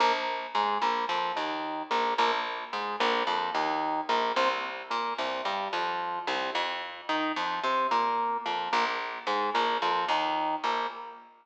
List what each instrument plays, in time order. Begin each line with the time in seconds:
0.00 electric bass (finger) A#1, drawbar organ A#3
0.55 electric bass (finger) G#2, drawbar organ G#3
0.82 electric bass (finger) A#1, drawbar organ A#3
1.09 electric bass (finger) F2, drawbar organ F3
1.36 electric bass (finger) D#2, drawbar organ D#3
1.90 electric bass (finger) A#1, drawbar organ A#3
2.18 electric bass (finger) A#1, drawbar organ A#3
2.73 electric bass (finger) G#2, drawbar organ G#3
3.00 electric bass (finger) A#1, drawbar organ A#3
3.27 electric bass (finger) F2, drawbar organ F3
3.54 electric bass (finger) D#2, drawbar organ D#3
4.09 electric bass (finger) A#1, drawbar organ A#3
4.36 electric bass (finger) C2, drawbar organ C4
4.90 electric bass (finger) A#2, drawbar organ A#3
5.18 electric bass (finger) C2, drawbar organ C3
5.45 electric bass (finger) G2, drawbar organ G3
5.73 electric bass (finger) F2, drawbar organ F3
6.27 electric bass (finger) C2, drawbar organ C3
6.55 electric bass (finger) F2
7.09 electric bass (finger) D#3, drawbar organ D#4
7.36 electric bass (finger) F2, drawbar organ F3
7.64 electric bass (finger) C3, drawbar organ C4
7.91 electric bass (finger) A#2, drawbar organ A#3
8.45 electric bass (finger) F2, drawbar organ F3
8.73 electric bass (finger) A#1, drawbar organ A#3
9.27 electric bass (finger) G#2, drawbar organ G#3
9.54 electric bass (finger) A#1, drawbar organ A#3
9.82 electric bass (finger) F2, drawbar organ F3
10.08 electric bass (finger) D#2, drawbar organ D#3
10.64 electric bass (finger) A#1, drawbar organ A#3